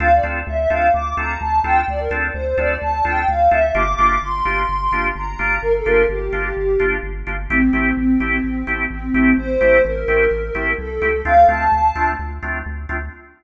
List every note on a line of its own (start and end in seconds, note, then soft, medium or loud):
0.00 0.20 D2 loud
0.00 0.08 C4 loud
0.00 0.08 D4 loud
0.00 0.08 F4 loud
0.00 0.08 A4 loud
0.00 0.11 F5 loud
0.14 0.25 D5 medium
0.23 0.43 D2 medium
0.23 0.40 C4 loud
0.23 0.40 D4 medium
0.23 0.40 F4 loud
0.23 0.40 A4 medium
0.47 0.67 D2 loud
0.47 0.56 E5 medium
0.57 0.68 E5 medium
0.68 0.90 D2 medium
0.68 0.87 C4 loud
0.68 0.87 D4 loud
0.68 0.87 F4 loud
0.68 0.87 A4 loud
0.68 0.87 F5 medium
0.94 1.14 D2 medium
0.94 1.13 D6 medium
1.17 1.37 D2 medium
1.17 1.34 C4 loud
1.17 1.34 D4 medium
1.17 1.34 F4 loud
1.17 1.34 A4 loud
1.17 1.38 A#5 medium
1.40 1.61 D2 medium
1.40 1.59 A5 medium
1.64 1.84 D2 medium
1.64 1.81 C4 loud
1.64 1.81 D4 loud
1.64 1.81 F4 loud
1.64 1.81 A4 loud
1.64 1.85 G5 medium
1.88 2.08 D2 loud
1.88 2.00 D5 medium
1.99 2.10 A#4 medium
2.11 2.30 D2 medium
2.11 2.27 C4 loud
2.11 2.27 D4 loud
2.11 2.27 F4 loud
2.11 2.27 A4 loud
2.34 2.54 D2 medium
2.34 2.45 C5 medium
2.45 2.57 C5 medium
2.58 2.77 D2 loud
2.58 2.74 C4 loud
2.58 2.74 D4 loud
2.58 2.74 F4 loud
2.58 2.74 A4 loud
2.58 2.77 D5 medium
2.82 3.02 D2 medium
2.82 3.05 A5 medium
3.05 3.25 D2 medium
3.05 3.21 C4 loud
3.05 3.21 D4 loud
3.05 3.21 F4 loud
3.05 3.21 A4 loud
3.05 3.28 G5 medium
3.28 3.48 D2 loud
3.28 3.47 F5 medium
3.51 3.71 D2 medium
3.51 3.59 C4 loud
3.51 3.59 D4 loud
3.51 3.59 F4 loud
3.51 3.59 A4 loud
3.51 3.74 E5 medium
3.75 3.95 G1 loud
3.75 3.83 A#3 loud
3.75 3.83 D4 loud
3.75 3.83 F4 loud
3.75 3.83 G4 loud
3.75 4.18 D6 medium
3.98 4.19 G1 loud
3.98 4.15 A#3 loud
3.98 4.15 D4 medium
3.98 4.15 F4 loud
3.98 4.15 G4 loud
4.22 4.42 G1 medium
4.22 5.04 C6 medium
4.45 4.65 G1 medium
4.45 4.62 A#3 loud
4.45 4.62 D4 medium
4.45 4.62 F4 medium
4.45 4.62 G4 loud
4.69 4.89 G1 medium
4.92 5.12 G1 medium
4.92 5.09 A#3 medium
4.92 5.09 D4 loud
4.92 5.09 F4 medium
4.92 5.09 G4 loud
5.16 5.35 G1 medium
5.16 5.61 A#5 medium
5.39 5.59 G1 medium
5.39 5.55 A#3 loud
5.39 5.55 D4 loud
5.39 5.55 F4 loud
5.39 5.55 G4 loud
5.62 5.82 G1 medium
5.62 5.73 A#4 medium
5.75 5.86 A4 medium
5.84 6.06 G1 medium
5.84 6.02 A#3 loud
5.84 6.02 D4 loud
5.84 6.02 F4 loud
5.84 6.02 G4 loud
5.84 6.04 A#4 medium
6.09 6.29 G1 medium
6.09 6.86 G4 medium
6.33 6.53 G1 medium
6.33 6.49 A#3 loud
6.33 6.49 D4 loud
6.33 6.49 F4 medium
6.33 6.49 G4 medium
6.57 6.77 G1 medium
6.80 7.00 G1 medium
6.80 6.96 A#3 medium
6.80 6.96 D4 loud
6.80 6.96 F4 loud
6.80 6.96 G4 medium
7.03 7.23 G1 medium
7.27 7.47 G1 loud
7.27 7.35 A#3 medium
7.27 7.35 D4 loud
7.27 7.35 F4 loud
7.27 7.35 G4 medium
7.50 7.70 A1 loud
7.50 7.58 A3 loud
7.50 7.91 C4 medium
7.50 7.58 C4 loud
7.50 7.58 E4 loud
7.50 7.58 G4 loud
7.73 7.93 A1 loud
7.73 7.89 A3 loud
7.73 7.89 C4 medium
7.73 7.89 E4 medium
7.73 7.89 G4 loud
7.96 8.17 A1 medium
7.96 8.77 C4 medium
8.20 8.40 A1 loud
8.20 8.37 A3 medium
8.20 8.37 C4 medium
8.20 8.37 E4 medium
8.20 8.37 G4 loud
8.44 8.64 A1 medium
8.67 8.87 A1 medium
8.67 8.83 A3 loud
8.67 8.83 C4 loud
8.67 8.83 E4 loud
8.67 8.83 G4 loud
8.90 9.10 A1 medium
8.90 9.33 C4 medium
9.14 9.34 A1 loud
9.14 9.31 A3 loud
9.14 9.31 C4 loud
9.14 9.31 E4 loud
9.14 9.31 G4 medium
9.38 9.58 A1 medium
9.38 9.83 C5 loud
9.61 9.81 A1 medium
9.61 9.77 A3 loud
9.61 9.77 C4 loud
9.61 9.77 E4 loud
9.61 9.77 G4 loud
9.85 10.05 A1 loud
9.85 10.70 A#4 medium
10.08 10.28 A1 medium
10.08 10.24 A3 loud
10.08 10.24 C4 loud
10.08 10.24 E4 loud
10.08 10.24 G4 loud
10.31 10.51 A1 loud
10.55 10.75 A1 medium
10.55 10.71 A3 loud
10.55 10.71 C4 medium
10.55 10.71 E4 loud
10.55 10.71 G4 loud
10.78 10.99 C2 medium
10.78 11.21 A4 medium
11.01 11.23 C#2 medium
11.01 11.10 A3 loud
11.01 11.10 C4 loud
11.01 11.10 E4 loud
11.01 11.10 G4 loud
11.25 11.45 D2 loud
11.25 11.33 A3 loud
11.25 11.33 C4 loud
11.25 11.33 D4 loud
11.25 11.33 F4 loud
11.25 11.45 F5 loud
11.48 11.68 D2 medium
11.48 11.65 A3 loud
11.48 11.65 C4 loud
11.48 11.65 D4 medium
11.48 11.65 F4 loud
11.48 12.07 A5 medium
11.72 11.92 D2 medium
11.95 12.15 D2 medium
11.95 12.12 A3 loud
11.95 12.12 C4 medium
11.95 12.12 D4 loud
11.95 12.12 F4 loud
12.19 12.39 D2 loud
12.43 12.62 D2 medium
12.43 12.59 A3 loud
12.43 12.59 C4 medium
12.43 12.59 D4 loud
12.43 12.59 F4 loud
12.66 12.86 D2 loud
12.89 13.09 D2 loud
12.89 12.97 A3 loud
12.89 12.97 C4 loud
12.89 12.97 D4 medium
12.89 12.97 F4 loud